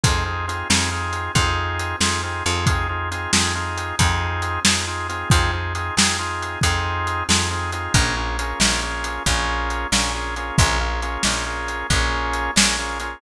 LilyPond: <<
  \new Staff \with { instrumentName = "Drawbar Organ" } { \time 12/8 \key f \minor \tempo 4. = 91 <c' ees' f' aes'>8 <c' ees' f' aes'>8 <c' ees' f' aes'>8 <c' ees' f' aes'>8 <c' ees' f' aes'>4 <c' ees' f' aes'>4. <c' ees' f' aes'>8 <c' ees' f' aes'>8 <c' ees' f' aes'>8 | <c' ees' f' aes'>8 <c' ees' f' aes'>8 <c' ees' f' aes'>8 <c' ees' f' aes'>8 <c' ees' f' aes'>4 <c' ees' f' aes'>4. <c' ees' f' aes'>8 <c' ees' f' aes'>8 <c' ees' f' aes'>8 | <c' ees' f' aes'>8 <c' ees' f' aes'>8 <c' ees' f' aes'>8 <c' ees' f' aes'>8 <c' ees' f' aes'>4 <c' ees' f' aes'>4. <c' ees' f' aes'>8 <c' ees' f' aes'>8 <c' ees' f' aes'>8 | <bes des' f' aes'>8 <bes des' f' aes'>8 <bes des' f' aes'>8 <bes des' f' aes'>8 <bes des' f' aes'>4 <bes des' f' aes'>4. <bes des' f' aes'>8 <bes des' f' aes'>8 <bes des' f' aes'>8 |
<bes des' f' aes'>8 <bes des' f' aes'>8 <bes des' f' aes'>8 <bes des' f' aes'>8 <bes des' f' aes'>4 <bes des' f' aes'>4. <bes des' f' aes'>8 <bes des' f' aes'>8 <bes des' f' aes'>8 | }
  \new Staff \with { instrumentName = "Electric Bass (finger)" } { \clef bass \time 12/8 \key f \minor f,4. f,4. f,4. f,4 f,8~ | f,4. f,4. f,4. f,4. | f,4. f,4. f,4. f,4. | bes,,4. bes,,4. bes,,4. bes,,4. |
bes,,4. bes,,4. bes,,4. bes,,4. | }
  \new DrumStaff \with { instrumentName = "Drums" } \drummode { \time 12/8 <hh bd>4 hh8 sn4 hh8 <hh bd>4 hh8 sn4 hh8 | <hh bd>4 hh8 sn4 hh8 <hh bd>4 hh8 sn4 hh8 | <hh bd>4 hh8 sn4 hh8 <hh bd>4 hh8 sn4 hh8 | <hh bd>4 hh8 sn4 hh8 <hh bd>4 hh8 sn4 hh8 |
<hh bd>4 hh8 sn4 hh8 <hh bd>4 hh8 sn4 hh8 | }
>>